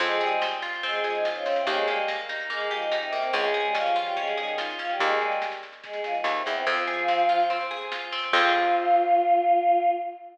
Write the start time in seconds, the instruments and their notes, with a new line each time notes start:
0.00 electric bass (finger) F2, choir aahs G#3 G#4, pizzicato strings C4, kick, snare
0.11 snare
0.20 choir aahs G3 G4, pizzicato strings G#4, snare
0.31 snare
0.42 pizzicato strings C4, snare
0.52 snare
0.62 pizzicato strings F4, snare
0.73 snare
0.83 choir aahs G#3 G#4, pizzicato strings C4, kick, snare
0.93 snare
1.03 choir aahs F3 F4, pizzicato strings G#4, snare
1.14 choir aahs D#3 D#4, snare
1.25 pizzicato strings F4, snare
1.35 choir aahs C#3 C#4, snare
1.46 pizzicato strings C4, snare
1.56 choir aahs C3 C4, snare
1.67 electric bass (finger) D#2, choir aahs G#3 G#4, pizzicato strings A#3, kick, snare
1.77 snare
1.88 choir aahs G3 G4, pizzicato strings G4, snare
1.97 snare
2.08 pizzicato strings A#3, snare
2.18 snare
2.29 pizzicato strings D#4, snare
2.40 snare
2.49 choir aahs G#3 G#4, pizzicato strings A#3, kick, snare
2.60 snare
2.71 choir aahs F3 F4, pizzicato strings G4, snare
2.82 choir aahs D#3 D#4, snare
2.92 pizzicato strings D#4, snare
3.02 choir aahs C3 C4, snare
3.12 pizzicato strings A#3, snare
3.22 choir aahs C3 C4, snare
3.32 electric bass (finger) C#2, choir aahs G#3 G#4, pizzicato strings C#4, kick, snare
3.44 snare
3.54 pizzicato strings G#4, snare
3.64 choir aahs G3 G4, snare
3.75 choir aahs F3 F4, pizzicato strings C#4, snare
3.86 snare
3.95 choir aahs F3 F4, pizzicato strings F4, snare
4.05 choir aahs G3 G4, snare
4.16 choir aahs G#3 G#4, pizzicato strings C#4, kick, snare
4.28 snare
4.38 choir aahs D#3 D#4, pizzicato strings G#4, snare
4.47 snare
4.58 pizzicato strings F4, snare
4.69 snare
4.79 choir aahs F3 F4, pizzicato strings C#4, snare
4.89 choir aahs G3 G4, snare
4.99 electric bass (finger) D#2, choir aahs G#3 G#4, kick, snare
5.11 snare
5.21 choir aahs G3 G4, snare
5.31 snare
5.42 snare
5.52 snare
5.63 snare
5.72 snare
5.84 choir aahs G#3 G#4, kick, snare
5.93 snare
6.04 choir aahs F3 F4, snare
6.14 choir aahs D#3 D#4, snare
6.24 electric bass (finger) D#2, snare
6.35 choir aahs C3 C4, snare
6.46 electric bass (finger) E2, snare
6.55 choir aahs C3 C4, snare
6.66 electric bass (finger) F2, choir aahs F3 F4, pizzicato strings C4, kick, snare
6.77 snare
6.87 pizzicato strings G#4, snare
6.98 snare
7.08 pizzicato strings C4, snare
7.18 snare
7.29 pizzicato strings F4, snare
7.40 snare
7.50 pizzicato strings C4, kick, snare
7.61 snare
7.71 pizzicato strings G#4, snare
7.81 snare
7.92 pizzicato strings F4, snare
8.02 snare
8.12 pizzicato strings C4, snare
8.23 snare
8.33 electric bass (finger) F2, pizzicato strings C4 F4, choir aahs F4, kick, crash
8.37 pizzicato strings G#4